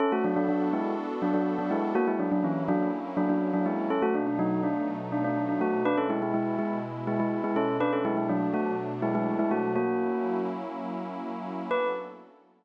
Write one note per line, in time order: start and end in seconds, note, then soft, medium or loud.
0.00 1.93 B3 medium
0.00 0.12 C#4 medium
0.00 1.93 D4 medium
0.00 1.93 F#4 medium
0.00 0.12 A4 medium
0.00 1.93 A4 medium
0.12 0.24 A3 medium
0.12 0.24 F#4 medium
0.24 0.36 F#3 medium
0.24 0.36 D4 medium
0.36 0.48 F#3 medium
0.36 0.48 D4 medium
0.49 0.69 F#3 medium
0.49 0.69 D4 medium
0.73 0.94 G#3 medium
0.73 0.94 E4 medium
1.22 1.34 F#3 medium
1.22 1.34 D4 medium
1.34 1.54 F#3 medium
1.34 1.54 D4 medium
1.59 1.70 F#3 medium
1.59 1.70 D4 medium
1.71 1.92 G#3 medium
1.71 1.92 E4 medium
1.95 3.88 F#3 medium
1.95 3.88 A#3 medium
1.95 2.07 A#3 medium
1.95 3.88 C#4 medium
1.95 3.88 E4 medium
1.95 2.07 F#4 loud
2.07 2.19 G#3 medium
2.07 2.19 E4 medium
2.19 2.31 F#3 medium
2.19 2.31 D4 medium
2.32 2.43 F#3 medium
2.32 2.43 D4 medium
2.44 2.63 E3 medium
2.44 2.63 C#4 medium
2.68 2.88 F#3 medium
2.68 2.88 D4 loud
3.17 3.29 F#3 medium
3.17 3.29 D4 medium
3.29 3.50 F#3 medium
3.29 3.50 D4 medium
3.54 3.65 F#3 medium
3.54 3.65 D4 medium
3.66 3.88 G#3 medium
3.66 3.88 E4 medium
3.90 5.84 B2 medium
3.90 5.84 F#3 medium
3.90 5.84 A3 medium
3.90 4.02 C#4 medium
3.90 5.84 D#4 medium
3.90 4.02 A4 medium
4.02 4.14 A3 medium
4.02 4.14 F#4 medium
4.15 4.26 D4 medium
4.27 4.38 D4 medium
4.39 4.61 F#3 medium
4.39 4.61 D#4 medium
4.63 4.85 D4 medium
5.12 5.24 D4 medium
5.24 5.44 D4 medium
5.49 5.60 D4 medium
5.61 5.83 A3 medium
5.61 5.83 F#4 medium
5.85 7.79 B2 medium
5.85 7.79 G#3 medium
5.85 5.97 D4 medium
5.85 7.79 E4 medium
5.85 5.97 B4 loud
5.97 6.09 C#4 medium
5.97 6.09 A4 medium
6.10 6.21 G#3 medium
6.10 6.21 E4 medium
6.22 6.34 G#3 medium
6.22 6.34 E4 medium
6.34 6.56 G#3 medium
6.34 6.56 E4 medium
6.59 6.78 G#3 medium
6.59 6.78 E4 medium
7.07 7.19 G#3 medium
7.07 7.19 E4 medium
7.20 7.40 G#3 medium
7.20 7.40 E4 medium
7.44 7.56 G#3 medium
7.44 7.56 E4 medium
7.56 7.77 C#4 medium
7.56 7.77 A4 medium
7.80 9.73 B2 medium
7.80 9.73 F#3 medium
7.80 9.73 A3 medium
7.80 9.73 D4 medium
7.80 7.92 D4 medium
7.80 7.92 B4 loud
7.93 8.04 C#4 medium
7.93 8.04 A4 medium
8.05 8.17 G#3 medium
8.05 8.17 E4 medium
8.17 8.29 G#3 medium
8.17 8.29 E4 medium
8.29 8.49 F#3 medium
8.29 8.49 D4 medium
8.54 8.74 A3 medium
8.54 8.74 F#4 medium
9.02 9.14 G#3 medium
9.02 9.14 E4 medium
9.15 9.38 G#3 medium
9.15 9.38 E4 medium
9.39 9.51 G#3 medium
9.39 9.51 E4 medium
9.51 9.71 A3 medium
9.51 9.71 F#4 medium
9.76 11.69 F#3 medium
9.76 10.39 A#3 medium
9.76 11.69 A#3 medium
9.76 11.69 C#4 medium
9.76 11.69 E4 medium
9.76 10.39 F#4 medium
11.71 11.88 B3 medium
11.71 11.88 D4 medium
11.71 11.88 F#4 loud
11.71 11.88 A4 loud
11.71 11.88 B4 loud